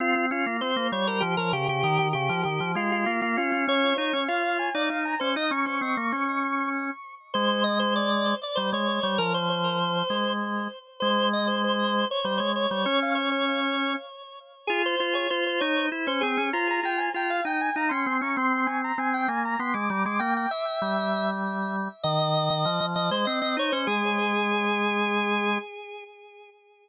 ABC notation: X:1
M:3/4
L:1/16
Q:1/4=98
K:Fm
V:1 name="Drawbar Organ"
F2 F2 c2 d B G B G G | G2 G2 G2 F F F F F F | d2 d2 f2 a =d f b c e | d' d'7 z4 |
[K:Ab] c2 e c =d3 d c _d d d | B c c6 z4 | c2 e c c3 d c d d d | d f d d5 z4 |
[K:Fm] A c c d c c d2 z c A2 | b b g a g f g a b c'2 d' | c' c' a b a g a b c' =d'2 d' | g g =e6 z4 |
[K:Ab] e6 e c e e d c | A12 |]
V:2 name="Drawbar Organ"
C C D B, C B, G,2 F, F, D, D, | E, E, D, F, E, F, A,2 B, B, D D | D2 E D F3 E E2 D E | D D C B, D6 z2 |
[K:Ab] A,8 G, A,2 G, | F,6 A,4 z2 | A,8 G, A,2 G, | D8 z4 |
[K:Fm] F2 F2 F2 E2 =E D C D | F2 F2 F2 E2 E D C D | C2 C2 C2 B,2 =B, A, G, A, | B,2 z2 G,8 |
[K:Ab] E,3 E, F, F, F, A, C C E D | A,12 |]